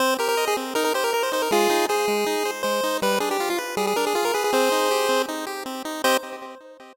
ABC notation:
X:1
M:4/4
L:1/16
Q:1/4=159
K:Cm
V:1 name="Lead 1 (square)"
c2 B B2 A z2 B B c B B c c B | [FA]4 A8 c4 | =B2 A G2 F z2 A A _B A A B A A | [Ac]8 z8 |
c4 z12 |]
V:2 name="Lead 1 (square)"
C2 G2 e2 C2 E2 G2 B2 E2 | A,2 E2 c2 A,2 E2 c2 A,2 E2 | G,2 D2 F2 =B2 G,2 D2 F2 B2 | C2 E2 G2 C2 E2 G2 C2 E2 |
[CGe]4 z12 |]